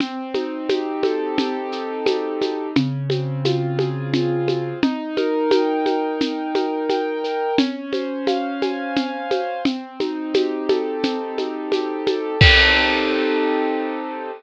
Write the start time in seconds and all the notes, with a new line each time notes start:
0.00 C4, low conga, shaker
0.34 D#4, high conga, shaker
0.69 G4, high conga, shaker
1.03 A4, high conga, shaker
1.38 G4, low conga, shaker
1.72 D#4, shaker
2.06 C4, high conga, shaker
2.41 D#4, high conga, shaker
2.76 C#3, low conga, shaker
3.10 C4, high conga, shaker
3.45 F4, high conga, shaker
3.79 G#4, high conga, shaker
4.14 F4, low conga, shaker
4.48 C4, high conga, shaker
4.82 D#4, low conga, shaker
5.17 A#4, high conga, shaker
5.51 G5, high conga, shaker
5.86 A#4, high conga, shaker
6.21 D#4, low conga, shaker
6.55 A#4, high conga, shaker
6.90 G5, high conga, shaker
7.24 A#4, shaker
7.58 C#4, low conga, shaker
7.93 C5, high conga, shaker
8.27 F5, high conga, shaker
8.62 G#5, high conga, shaker
8.96 F5, low conga, shaker
9.31 C5, high conga, shaker
9.65 C4, low conga, shaker
10.00 D#4, high conga, shaker
10.34 G4, high conga, shaker
10.69 A4, high conga, shaker
11.03 C4, low conga, shaker
11.38 D#4, high conga, shaker
11.72 G4, high conga, shaker
12.07 A4, high conga, shaker
12.41 C4 D#4 G4 A4, kick, crash